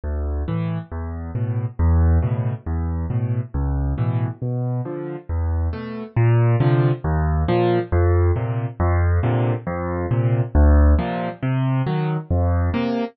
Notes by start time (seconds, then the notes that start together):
0.04 D2
0.48 A2 E3
0.91 E2
1.35 A2 B2
1.79 E2
2.22 A2 B2 C#3
2.66 E2
3.10 A2 B2
3.54 C#2
3.98 A2 B2 E3
4.42 B2
4.85 D3 F3
5.29 E2
5.73 B2 A3
6.16 A#2
6.60 C3 D3 F3
7.04 D#2
7.48 A#2 F3
7.92 F2
8.36 A#2 C3
8.80 F2
9.23 A#2 C3 D3
9.67 F2
10.11 A#2 C3
10.55 D2
10.98 A#2 C3 F3
11.42 C3
11.86 D#3 F#3
12.30 F2
12.74 C3 A#3